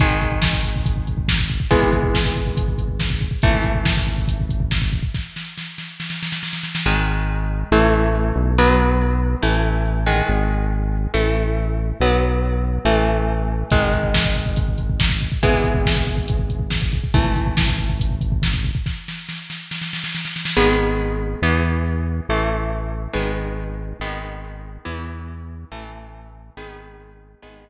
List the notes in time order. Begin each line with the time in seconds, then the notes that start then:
0.00 G#1 D#3 G#3, kick, closed hi-hat
0.11 kick
0.21 kick, closed hi-hat
0.32 kick
0.42 kick, snare
0.53 kick
0.63 kick, closed hi-hat
0.76 kick
0.86 kick, closed hi-hat
0.97 kick
1.07 kick, closed hi-hat
1.18 kick
1.28 kick, snare
1.39 kick
1.50 kick, closed hi-hat
1.60 kick
1.70 G#1 E3 G#3 B3, kick, closed hi-hat
1.82 kick
1.93 kick, closed hi-hat
2.03 kick
2.14 kick, snare
2.25 kick
2.35 kick, closed hi-hat
2.46 kick
2.57 kick, closed hi-hat
2.68 kick
2.78 kick, closed hi-hat
2.88 kick
3.00 kick, snare
3.10 kick
3.21 kick, closed hi-hat
3.31 kick
3.42 G#1 E3 A3, kick, closed hi-hat
3.53 kick
3.63 kick, closed hi-hat
3.75 kick
3.85 kick, snare
3.97 kick
4.06 kick, closed hi-hat
4.18 kick
4.28 kick, closed hi-hat
4.40 kick
4.49 kick, closed hi-hat
4.60 kick
4.71 kick, snare
4.82 kick
4.93 kick, closed hi-hat
5.03 kick
5.14 kick, snare
5.36 snare
5.58 snare
5.78 snare
6.00 snare
6.10 snare
6.23 snare
6.32 snare
6.43 snare
6.53 snare
6.63 snare
6.75 snare
6.86 G#1 D#3 G#3
7.71 A1 E3 A3
8.36 B1
8.58 F#3 B3
9.42 A1 E3 A3
10.06 D#3 G#3
10.29 G#1
11.14 A1 E3 A3
12.00 B1 F#3 B3
12.85 A1 E3 A3
13.70 G#1 D#3 G#3, kick, closed hi-hat
13.82 kick
13.93 kick, closed hi-hat
14.03 kick
14.14 kick, snare
14.24 kick
14.35 kick, closed hi-hat
14.46 kick
14.56 kick, closed hi-hat
14.68 kick
14.78 kick, closed hi-hat
14.90 kick
14.99 kick, snare
15.10 kick
15.22 kick, closed hi-hat
15.32 kick
15.42 G#1 E3 G#3 B3, kick, closed hi-hat
15.53 kick
15.64 kick, closed hi-hat
15.74 kick
15.85 kick, snare
15.97 kick
16.07 kick, closed hi-hat
16.17 kick
16.28 kick, closed hi-hat
16.39 kick
16.50 kick, closed hi-hat
16.60 kick
16.70 kick, snare
16.82 kick
16.92 kick, closed hi-hat
17.04 kick
17.14 G#1 E3 A3, kick, closed hi-hat
17.25 kick
17.36 kick, closed hi-hat
17.47 kick
17.57 kick, snare
17.68 kick
17.78 kick, closed hi-hat
17.89 kick
18.00 kick, closed hi-hat
18.10 kick
18.21 kick, closed hi-hat
18.32 kick
18.42 kick, snare
18.54 kick
18.64 kick, closed hi-hat
18.75 kick
18.86 kick, snare
19.08 snare
19.29 snare
19.50 snare
19.71 snare
19.82 snare
19.93 snare
20.04 snare
20.15 snare
20.25 snare
20.36 snare
20.45 snare
20.57 G#1 D#3 G#3 B3
21.42 E2 E3 B3
22.29 A1 E3 A3
23.13 G#1 D#3 G#3 B3
24.00 G#1 D#3 G#3 B3
24.85 E2 E3 B3
25.71 A1 E3 A3
26.57 G#1 D#3 G#3 B3
27.42 G#1 D#3 G#3 B3